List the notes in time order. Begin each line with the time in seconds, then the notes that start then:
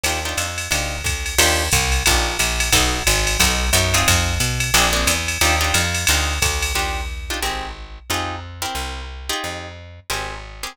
0.03 D#2 D4 D#4 F4 G4, ride
0.25 D4 D#4 F4 G4
0.37 F2, hi-hat pedal, ride
0.58 ride
0.71 D2 D4 D#4 F4 G4, ride
1.04 D2, kick, hi-hat pedal, ride
1.26 ride
1.38 D#2 D4 D#4 F4 G4, crash, ride
1.72 C2, kick, hi-hat pedal, ride
1.92 ride
2.06 A#1 D4 D#4 F4 G4, kick, ride
2.39 A#1, hi-hat pedal, ride
2.60 ride
2.72 B1 B3 D#4 F#4 A4, kick, ride
3.07 G#1, hi-hat pedal, ride
3.27 ride
3.39 B1 B3 D#4 F#4 A4, kick, ride
3.73 F#2 B3 D#4 F#4 A4, hi-hat pedal, ride
3.94 C4 D#4 F4 G#4, ride
4.08 F2, kick, ride
4.40 B2, hi-hat pedal, ride
4.60 ride
4.74 A#1 A#3 C4 D4 G#4, ride
4.93 A#3 C4 D4 G#4
5.07 E2, hi-hat pedal, ride
5.28 ride
5.41 D#2 D4 D#4 F4 G4, ride
5.61 D4 D#4 F4 G4
5.74 F2, hi-hat pedal, ride
5.94 ride
6.07 D2 D4 D#4 F4 G4, ride
6.42 D2, kick, hi-hat pedal, ride
6.62 ride
6.75 D#2 D4 D#4 F4 G4
7.30 D4 D#4 F4 G4
7.42 G#1 C4 G4 G#4 A#4
8.10 F2 D#4 F4 G4 G#4
8.62 C4 E4 G4 A#4
8.75 C2
9.29 D#4 F4 G4 G#4
9.44 F2
10.10 G#1 C4 G4 G#4 A#4
10.63 C4 G4 G#4 A#4